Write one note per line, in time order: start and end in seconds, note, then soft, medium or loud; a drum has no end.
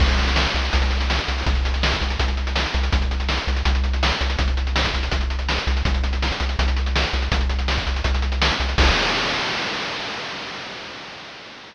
0.00 0.47 C2 medium
0.00 kick loud
0.00 crash medium
0.09 closed hi-hat medium
0.19 closed hi-hat medium
0.27 closed hi-hat medium
0.36 snare loud
0.47 closed hi-hat medium
0.54 0.70 C2 medium
0.54 closed hi-hat medium
0.65 closed hi-hat medium
0.73 1.20 C2 medium
0.73 kick medium
0.73 closed hi-hat medium
0.82 closed hi-hat medium
0.91 closed hi-hat medium
1.01 closed hi-hat medium
1.10 snare medium
1.19 closed hi-hat medium
1.28 1.44 C2 medium
1.28 closed hi-hat medium
1.38 open hi-hat medium
1.46 1.93 C2 medium
1.46 kick loud
1.46 closed hi-hat medium
1.55 closed hi-hat medium
1.65 closed hi-hat medium
1.74 closed hi-hat medium
1.83 snare loud
1.92 kick medium
1.92 closed hi-hat medium
2.01 2.17 C2 medium
2.01 closed hi-hat medium
2.10 closed hi-hat medium
2.19 2.67 C2 medium
2.19 kick medium
2.19 closed hi-hat medium
2.28 closed hi-hat medium
2.37 closed hi-hat medium
2.47 closed hi-hat medium
2.56 snare medium
2.66 closed hi-hat medium
2.74 2.90 C2 medium
2.74 closed hi-hat medium
2.83 closed hi-hat medium
2.92 3.39 C2 medium
2.92 kick medium
2.92 closed hi-hat medium
3.02 closed hi-hat medium
3.11 closed hi-hat medium
3.20 closed hi-hat medium
3.29 snare medium
3.38 closed hi-hat medium
3.47 3.63 C2 medium
3.47 closed hi-hat medium
3.56 closed hi-hat medium
3.65 4.12 C2 medium
3.65 kick medium
3.65 closed hi-hat medium
3.75 closed hi-hat medium
3.84 closed hi-hat medium
3.93 closed hi-hat medium
4.03 snare loud
4.12 closed hi-hat medium
4.21 4.36 C2 medium
4.21 closed hi-hat medium
4.30 closed hi-hat medium
4.39 4.86 C2 medium
4.39 kick medium
4.39 closed hi-hat medium
4.48 closed hi-hat medium
4.57 closed hi-hat medium
4.67 closed hi-hat medium
4.76 snare loud
4.85 kick medium
4.85 closed hi-hat medium
4.94 5.09 C2 medium
4.94 closed hi-hat medium
5.03 closed hi-hat medium
5.12 5.59 C2 medium
5.12 kick medium
5.12 closed hi-hat medium
5.21 closed hi-hat medium
5.30 closed hi-hat medium
5.39 closed hi-hat medium
5.49 snare medium
5.58 closed hi-hat medium
5.67 5.83 C2 medium
5.67 closed hi-hat medium
5.77 closed hi-hat medium
5.85 6.32 C2 medium
5.85 kick medium
5.85 closed hi-hat medium
5.94 closed hi-hat medium
6.04 closed hi-hat medium
6.13 closed hi-hat medium
6.22 snare medium
6.32 closed hi-hat medium
6.40 6.56 C2 medium
6.40 closed hi-hat medium
6.49 closed hi-hat medium
6.59 7.05 C2 medium
6.59 kick medium
6.59 closed hi-hat medium
6.68 closed hi-hat medium
6.77 closed hi-hat medium
6.86 closed hi-hat medium
6.96 snare loud
7.04 closed hi-hat medium
7.13 7.29 C2 medium
7.13 closed hi-hat medium
7.22 closed hi-hat medium
7.32 7.78 C2 medium
7.32 kick medium
7.32 closed hi-hat loud
7.41 closed hi-hat medium
7.49 closed hi-hat medium
7.59 closed hi-hat medium
7.68 snare medium
7.78 kick medium
7.78 closed hi-hat medium
7.87 8.02 C2 medium
7.87 closed hi-hat medium
7.96 closed hi-hat medium
8.04 8.51 C2 medium
8.04 kick medium
8.04 closed hi-hat medium
8.14 closed hi-hat medium
8.22 closed hi-hat medium
8.32 closed hi-hat medium
8.42 snare loud
8.51 closed hi-hat medium
8.60 8.75 C2 medium
8.60 closed hi-hat medium
8.69 closed hi-hat medium
8.78 8.91 C2 loud
8.78 kick loud
8.78 crash loud